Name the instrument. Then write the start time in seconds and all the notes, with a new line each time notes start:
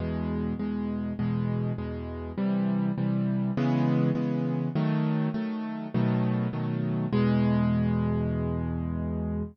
acoustic grand piano
0.00 E2 B2 G#3
0.59 E2 B2 G#3
1.19 E2 B2 G#3
1.78 E2 B2 G#3
2.38 C3 E3 G3
2.98 C3 E3 G3
3.57 C#3 E3 G#3 B3
4.15 C#3 E3 G#3 B3
4.75 D#3 F#3 A3
5.34 D#3 F#3 A3
5.94 B2 D#3 F#3 A3
6.53 B2 D#3 F#3 A3
7.13 E2 B2 G#3